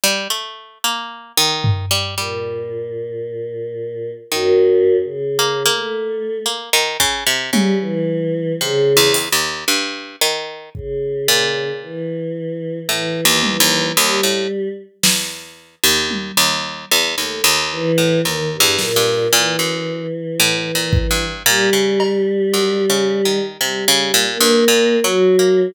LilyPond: <<
  \new Staff \with { instrumentName = "Pizzicato Strings" } { \time 2/4 \tempo 4 = 56 g16 a8 bes8 ees8 g16 | g2 | ees4 bes16 bes8. | bes16 ees16 des16 c16 des4 |
\tuplet 3/2 { c8 e,8 ees,8 } g,8 ees8 | r8 bes,4 r8 | \tuplet 3/2 { a,8 ees,8 ees,8 } ees,16 a,16 r8 | e,8. ees,8 ees,8 e,16 |
ees,16 ees,8 a,16 \tuplet 3/2 { ees,8 e,8 g,8 } | bes,16 ges,8 r16 \tuplet 3/2 { a,8 bes,8 g,8 } | bes,16 des8. \tuplet 3/2 { ges,8 des8 ees8 } | c16 des16 bes,16 g,16 \tuplet 3/2 { bes,8 ges8 bes8 } | }
  \new Staff \with { instrumentName = "Choir Aahs" } { \time 2/4 r2 | bes,2 | \tuplet 3/2 { ges,4 des4 a4 } | r4 g16 e8. |
des8 r4. | des4 e4 | e8 e8 g8. r16 | r2 |
a16 r16 e8 ees16 g,16 bes,8 | e2 | g2 | \tuplet 3/2 { g4 bes4 ges4 } | }
  \new DrumStaff \with { instrumentName = "Drums" } \drummode { \time 2/4 r4 r8 tomfh8 | r4 r4 | r4 r4 | r8 bd8 tommh4 |
r8 hh8 r4 | bd8 cb8 r4 | r8 tommh8 r4 | sn4 tommh4 |
r4 r8 sn8 | r4 r8 bd8 | r8 cb8 r4 | r4 r4 | }
>>